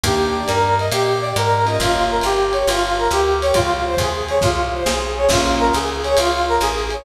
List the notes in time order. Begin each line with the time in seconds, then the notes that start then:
0.04 D#2 A#3 D4 D#4 G4, kick, ride
0.36 D5
0.48 G2 A#4, hi-hat pedal, ride
0.78 D#5, ride
0.92 A#2 G4, ride
1.22 D5
1.36 G#2 A#4, hi-hat pedal, ride
1.66 A#3 C#4 F4 G4 D#5, ride
1.79 G1 F4, kick, ride
2.10 A#4
2.21 G1 G4, hi-hat pedal, ride
2.53 C#5, ride
2.67 G1 F4, ride
2.98 A#4
3.11 D2 G4, hi-hat pedal, ride
3.42 C#5, ride
3.54 C#2 F4, kick, ride
3.86 C5
3.97 D#2 G#4, kick, hi-hat pedal, ride
4.29 C#5, ride
4.41 C2 F4, kick, snare
4.74 C5
4.85 B1 G#4, snare
5.16 C#5
5.29 A#1 A#3 C#4 F4 G#4, kick, crash, ride
5.60 A#4
5.73 C#2 G#4, hi-hat pedal, ride
6.04 C#5, ride
6.17 C#2 F4, ride
6.48 A#4
6.60 A1 G#4, hi-hat pedal, ride
6.90 C#5, ride